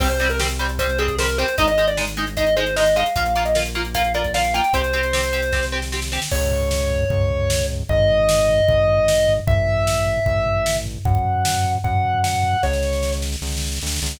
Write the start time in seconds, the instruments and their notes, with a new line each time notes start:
0.00 synth bass 1 C2, overdriven guitar G3 C4, lead 1 (square) C5, kick, crash
0.10 lead 1 (square) C5, closed hi-hat
0.20 overdriven guitar G3 C4, closed hi-hat
0.30 lead 1 (square) A#4, closed hi-hat
0.39 overdriven guitar G3 C4, snare
0.49 closed hi-hat
0.59 overdriven guitar G3 C4, closed hi-hat
0.69 closed hi-hat
0.79 overdriven guitar G3 C4, lead 1 (square) C5, kick, closed hi-hat
0.89 closed hi-hat
0.98 overdriven guitar G3 C4, lead 1 (square) G#4, closed hi-hat
1.08 kick, closed hi-hat
1.19 overdriven guitar G3 C4, lead 1 (square) A#4, snare
1.28 closed hi-hat
1.38 overdriven guitar G3 C4, lead 1 (square) C5, closed hi-hat
1.48 closed hi-hat
1.58 synth bass 1 G#1, overdriven guitar G#3 D#4, lead 1 (square) D#5, kick, closed hi-hat
1.68 lead 1 (square) D#5, closed hi-hat
1.78 overdriven guitar G#3 D#4, closed hi-hat
1.88 lead 1 (square) D5, closed hi-hat
1.97 overdriven guitar G#3 D#4, snare
2.07 closed hi-hat
2.17 overdriven guitar G#3 D#4, closed hi-hat
2.27 closed hi-hat
2.37 overdriven guitar G#3 D#4, lead 1 (square) D#5, kick, closed hi-hat
2.47 closed hi-hat
2.56 overdriven guitar G#3 D#4, lead 1 (square) C5, closed hi-hat
2.66 closed hi-hat
2.76 overdriven guitar G#3 D#4, lead 1 (square) D#5, snare
2.86 closed hi-hat
2.96 overdriven guitar G#3 D#4, lead 1 (square) F5, closed hi-hat
3.06 closed hi-hat
3.16 synth bass 1 A#1, overdriven guitar A#3 F4, lead 1 (square) F5, kick, closed hi-hat
3.26 lead 1 (square) F5, closed hi-hat
3.35 overdriven guitar A#3 F4, closed hi-hat
3.45 lead 1 (square) D#5, closed hi-hat
3.55 overdriven guitar A#3 F4, snare
3.65 closed hi-hat
3.75 overdriven guitar A#3 F4, closed hi-hat
3.85 closed hi-hat
3.94 overdriven guitar A#3 F4, lead 1 (square) F5, kick, closed hi-hat
4.04 closed hi-hat
4.14 overdriven guitar A#3 F4, lead 1 (square) D5, closed hi-hat
4.24 kick, closed hi-hat
4.34 overdriven guitar A#3 F4, lead 1 (square) F5, snare
4.44 closed hi-hat
4.54 overdriven guitar A#3 F4, lead 1 (square) G5, closed hi-hat
4.64 closed hi-hat
4.73 synth bass 1 C2, overdriven guitar C4 G4, lead 1 (square) C5, kick, closed hi-hat
4.84 closed hi-hat
4.93 overdriven guitar C4 G4, closed hi-hat
5.03 closed hi-hat
5.13 overdriven guitar C4 G4, snare
5.23 closed hi-hat
5.33 overdriven guitar C4 G4, closed hi-hat
5.42 closed hi-hat
5.52 overdriven guitar C4 G4, kick, snare
5.63 snare
5.72 overdriven guitar C4 G4
5.82 snare
5.92 overdriven guitar C4 G4, snare
6.02 snare
6.12 overdriven guitar C4 G4, snare
6.22 snare
6.31 synth bass 1 C#2, lead 1 (square) C#5, kick, crash
6.41 floor tom
6.51 floor tom
6.61 floor tom
6.71 snare
6.81 floor tom
6.91 floor tom
7.01 floor tom
7.10 synth bass 1 C#2, kick, floor tom
7.20 floor tom
7.30 floor tom
7.40 floor tom
7.50 snare
7.60 floor tom
7.69 floor tom
7.79 floor tom
7.89 synth bass 1 G#1, lead 1 (square) D#5, kick, floor tom
7.99 floor tom
8.09 floor tom
8.19 floor tom
8.29 snare
8.39 floor tom
8.48 floor tom
8.59 floor tom
8.68 synth bass 1 G#1, kick, floor tom
8.78 floor tom
8.88 floor tom
8.98 floor tom
9.08 snare
9.18 floor tom
9.28 floor tom
9.37 floor tom
9.47 synth bass 1 A1, lead 1 (square) E5, kick, floor tom
9.57 floor tom
9.67 floor tom
9.77 floor tom
9.87 snare
9.97 floor tom
10.06 floor tom
10.17 floor tom
10.26 synth bass 1 A1, kick, floor tom
10.36 floor tom
10.46 floor tom
10.56 floor tom
10.66 snare
10.76 floor tom
10.86 floor tom
10.95 floor tom
11.05 synth bass 1 F#2, lead 1 (square) F#5, kick, floor tom
11.15 kick, floor tom
11.25 floor tom
11.35 floor tom
11.45 snare
11.54 floor tom
11.64 floor tom
11.74 floor tom
11.84 synth bass 1 F#2, lead 1 (square) F#5, kick, floor tom
11.94 floor tom
12.04 floor tom
12.14 floor tom
12.24 lead 1 (square) F#5, snare
12.34 floor tom
12.43 floor tom
12.53 floor tom
12.63 synth bass 1 C#2, lead 1 (square) C#5, kick, snare
12.73 snare
12.83 snare
12.93 snare
13.03 snare
13.12 snare
13.22 snare
13.32 snare
13.42 synth bass 1 C#2, snare
13.47 snare
13.52 snare
13.57 snare
13.61 snare
13.67 snare
13.72 snare
13.76 snare
13.81 synth bass 1 D2, snare
13.87 snare
13.92 snare
13.96 snare
14.02 synth bass 1 C#2, snare
14.06 snare
14.11 snare
14.16 snare